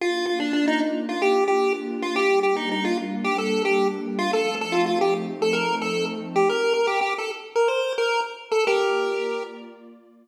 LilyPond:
<<
  \new Staff \with { instrumentName = "Lead 1 (square)" } { \time 4/4 \key bes \major \tempo 4 = 111 f'8 f'16 d'16 d'16 ees'16 r8 f'16 g'8 g'8 r8 f'16 | g'8 g'16 ees'16 ees'16 f'16 r8 g'16 a'8 g'8 r8 f'16 | a'8 a'16 f'16 f'16 g'16 r8 a'16 bes'8 a'8 r8 g'16 | bes'8 bes'16 g'16 g'16 a'16 r8 bes'16 c''8 bes'8 r8 a'16 |
<g' bes'>4. r2 r8 | }
  \new Staff \with { instrumentName = "Pad 2 (warm)" } { \time 4/4 \key bes \major <bes d' f'>1 | <g bes d'>1 | <f a c' ees'>1 | r1 |
<bes f' d''>1 | }
>>